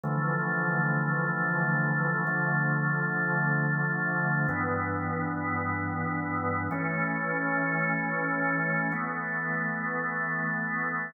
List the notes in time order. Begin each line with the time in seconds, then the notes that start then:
0.03 D3 E3 F3 A3
2.27 D3 F3 A3
4.48 G2 E3 B3
6.71 E3 A3 C#4
8.92 E3 A3 B3